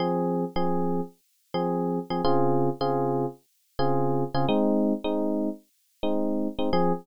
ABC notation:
X:1
M:4/4
L:1/16
Q:1/4=107
K:Fm
V:1 name="Electric Piano 1"
[F,CA]4 [F,CA]7 [F,CA]4 [F,CA] | [D,CFA]4 [D,CFA]7 [D,CFA]4 [D,CFA] | [A,CE]4 [A,CE]7 [A,CE]4 [A,CE] | [F,CA]4 z12 |]